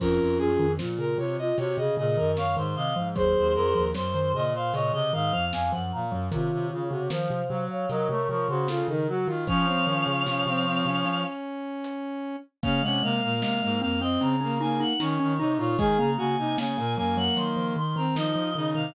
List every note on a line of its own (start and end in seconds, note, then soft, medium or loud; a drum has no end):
0.00 0.19 F2 medium
0.00 0.58 F3 medium
0.00 0.66 C#4 medium
0.00 0.66 F4 medium
0.00 0.38 A#4 loud
0.00 kick loud
0.00 crash loud
0.20 0.39 F2 medium
0.38 0.57 F#2 medium
0.38 0.72 G#4 loud
0.59 0.78 F2 medium
0.59 0.78 D#3 medium
0.79 1.17 A#2 medium
0.79 0.98 F3 medium
0.79 1.36 F4 medium
0.79 snare loud
0.99 1.17 C#3 medium
0.99 1.18 A#4 loud
1.18 1.37 C3 medium
1.18 1.52 C3 medium
1.18 1.37 C#5 loud
1.38 1.57 F4 medium
1.38 1.57 D#5 loud
1.58 1.77 C3 medium
1.58 1.77 F#4 medium
1.58 1.77 C#5 loud
1.58 closed hi-hat loud
1.77 1.96 C3 medium
1.77 1.98 C#3 medium
1.77 1.96 G#4 medium
1.77 1.95 D#5 loud
1.97 2.17 A#2 medium
1.97 2.16 C#3 medium
1.97 2.16 G#4 medium
1.97 2.31 D#5 loud
2.17 2.36 F#2 medium
2.17 2.54 D#3 medium
2.17 2.36 A#4 medium
2.37 2.56 F#2 medium
2.37 2.55 C#5 medium
2.37 2.56 F5 loud
2.37 snare loud
2.56 2.75 G#2 medium
2.56 2.91 D#3 medium
2.56 2.75 C5 medium
2.75 2.94 C3 medium
2.75 2.95 D#5 medium
2.75 3.09 F5 medium
2.96 3.15 G#2 medium
2.96 3.15 F3 medium
3.16 3.35 D#2 medium
3.16 3.63 F#3 medium
3.16 3.82 G#4 medium
3.16 3.82 C5 loud
3.16 3.54 C5 loud
3.16 kick loud
3.16 closed hi-hat loud
3.37 3.56 D#2 medium
3.54 3.74 F2 medium
3.54 3.91 A#4 loud
3.75 3.94 D#2 medium
3.75 3.94 F3 medium
3.94 4.33 F#2 medium
3.94 4.13 F#3 medium
3.94 4.42 C5 loud
3.94 snare loud
4.13 4.33 D#3 medium
4.13 4.32 C5 loud
4.34 4.71 A#2 medium
4.34 4.53 C#3 medium
4.34 4.54 D#5 loud
4.54 4.73 C5 medium
4.54 4.75 F5 loud
4.73 4.92 A#2 medium
4.73 4.92 C#3 medium
4.73 4.93 C#5 medium
4.73 4.92 D#5 loud
4.73 closed hi-hat loud
4.93 5.11 C3 medium
4.93 5.12 C#3 medium
4.93 5.12 D#5 medium
4.93 5.13 D#5 medium
5.13 5.32 G#2 medium
5.13 5.32 D#3 medium
5.13 5.32 D#5 medium
5.13 5.45 F5 loud
5.33 5.52 F2 medium
5.33 5.69 F3 medium
5.33 5.51 F5 medium
5.52 5.71 F2 medium
5.52 5.71 F5 loud
5.52 5.72 G#5 medium
5.52 snare loud
5.72 5.92 F#2 medium
5.72 6.05 F3 medium
5.72 5.91 F#5 medium
5.92 6.12 A#2 medium
5.92 6.27 F5 medium
5.92 6.11 A#5 medium
6.11 6.29 F#2 medium
6.11 6.31 F#3 medium
6.31 6.51 C3 medium
6.31 6.82 D#3 medium
6.31 6.67 F4 loud
6.31 7.08 C#5 medium
6.31 7.08 F5 medium
6.31 kick loud
6.31 closed hi-hat loud
6.52 6.71 C3 medium
6.70 6.91 C#3 medium
6.70 6.88 F4 loud
6.90 7.08 C3 medium
6.90 7.10 C#3 medium
6.90 7.09 F#4 loud
7.10 7.29 D#3 medium
7.10 7.42 F3 medium
7.10 7.65 C5 medium
7.10 7.60 F5 medium
7.10 snare loud
7.30 7.49 C3 medium
7.49 7.69 C3 medium
7.49 7.86 F#3 medium
7.70 7.89 C#5 loud
7.70 7.88 F5 medium
7.89 8.08 C3 medium
7.89 8.08 F#3 medium
7.89 8.08 A#4 loud
7.89 8.08 D#5 medium
7.89 closed hi-hat medium
8.08 8.28 C3 medium
8.08 8.28 A3 medium
8.08 8.27 A#4 loud
8.08 8.28 C#5 medium
8.28 8.48 C3 medium
8.28 8.48 F3 medium
8.28 8.47 A#4 medium
8.28 8.48 C#5 medium
8.49 8.82 C#3 medium
8.49 8.68 C#3 medium
8.49 8.68 F#4 loud
8.49 8.67 C5 medium
8.68 8.88 C#3 medium
8.68 8.87 F4 loud
8.68 8.87 A4 medium
8.68 snare loud
8.88 9.26 C#3 medium
8.88 9.08 D#3 medium
8.88 9.07 D#4 medium
8.88 9.07 A#4 medium
9.08 9.27 F#3 medium
9.08 9.27 F#4 medium
9.08 9.28 F#4 loud
9.26 9.46 D#3 medium
9.26 9.47 D#3 medium
9.26 9.45 F4 loud
9.47 9.66 F3 medium
9.47 11.24 F3 medium
9.47 9.66 C#4 loud
9.47 11.22 C#5 medium
9.47 11.22 F5 medium
9.47 kick loud
9.47 closed hi-hat medium
9.67 9.86 C4 loud
9.87 10.06 D#3 medium
9.87 10.23 C#4 loud
10.07 10.25 C#3 medium
10.26 10.45 C3 medium
10.26 10.46 C#4 medium
10.26 snare loud
10.46 10.81 C3 medium
10.46 10.66 C4 loud
10.67 10.86 C4 loud
10.85 11.04 C3 medium
10.85 12.36 C#4 loud
11.05 12.02 C#4 medium
11.05 closed hi-hat loud
11.84 closed hi-hat loud
12.63 12.81 C#3 medium
12.63 12.82 A#3 medium
12.63 12.82 C#4 loud
12.63 12.82 F5 medium
12.63 kick loud
12.63 closed hi-hat loud
12.83 13.02 C3 medium
12.83 13.02 G#3 medium
12.83 13.02 C#4 loud
12.83 13.02 F#5 medium
13.02 13.21 C3 medium
13.02 13.36 G#3 medium
13.02 13.21 A#3 loud
13.02 13.39 F5 medium
13.22 13.42 A#2 medium
13.22 13.40 A#3 loud
13.41 13.61 C3 medium
13.41 13.61 G#3 medium
13.41 13.60 A#3 medium
13.41 13.79 F5 medium
13.41 snare loud
13.62 13.82 G#2 medium
13.62 13.81 G#3 medium
13.62 13.80 A#3 loud
13.81 14.17 F2 medium
13.81 14.00 A#3 loud
13.81 14.00 C4 medium
13.81 14.00 F5 medium
14.00 14.36 C4 loud
14.00 14.20 C4 medium
14.00 14.20 D#5 medium
14.20 14.84 C#3 medium
14.20 14.40 C4 medium
14.20 14.56 A#5 medium
14.20 closed hi-hat medium
14.41 14.59 A#3 loud
14.41 14.60 C#4 medium
14.59 14.93 A#3 loud
14.59 14.79 D#4 medium
14.59 14.79 G#5 medium
14.80 14.99 D#4 medium
14.80 14.99 F#5 medium
14.99 15.18 D#3 medium
14.99 15.33 C#4 loud
14.99 15.19 D#4 medium
14.99 15.50 C#5 medium
14.99 snare loud
15.20 15.39 D#3 medium
15.20 15.38 C#4 medium
15.39 15.58 C3 medium
15.39 15.58 D#4 loud
15.39 15.58 D#4 medium
15.58 15.76 A#2 medium
15.58 15.78 D#4 medium
15.58 15.77 F4 loud
15.58 15.78 C#5 medium
15.78 15.98 D#3 medium
15.78 15.98 G#3 medium
15.78 16.11 G#4 loud
15.78 15.98 G#5 medium
15.78 kick loud
15.78 closed hi-hat loud
15.98 16.16 C#3 medium
15.98 16.17 A#3 medium
15.98 16.17 A#5 medium
16.17 16.37 C#3 medium
16.17 16.55 A#3 medium
16.17 16.36 F#4 loud
16.17 16.57 G#5 medium
16.38 16.57 C3 medium
16.38 16.57 D#4 loud
16.58 16.77 C#3 medium
16.58 16.77 A#3 medium
16.58 16.76 C#4 medium
16.58 16.94 G#5 medium
16.58 snare loud
16.77 16.96 A#2 medium
16.77 16.96 A#3 loud
16.77 16.96 A#3 medium
16.97 17.29 F#2 medium
16.97 17.16 F#3 medium
16.97 17.76 A#3 loud
16.97 17.16 G#5 medium
17.17 17.36 F#3 medium
17.17 17.36 F#5 medium
17.37 18.06 D#3 medium
17.37 17.56 F#3 medium
17.37 17.71 C6 medium
17.37 closed hi-hat loud
17.57 17.75 F3 medium
17.76 17.95 D#3 medium
17.76 17.95 C6 medium
17.96 18.15 D#3 medium
17.96 18.16 C4 loud
17.96 18.15 A#5 medium
18.15 18.35 D#3 medium
18.15 18.34 F3 medium
18.15 18.50 D#4 loud
18.15 18.66 D#5 medium
18.15 snare loud
18.36 18.54 F3 medium
18.55 18.74 C#3 medium
18.55 18.74 D#3 medium
18.55 18.91 D#4 loud
18.75 18.94 C3 medium
18.75 18.94 D#3 medium
18.75 18.94 F5 medium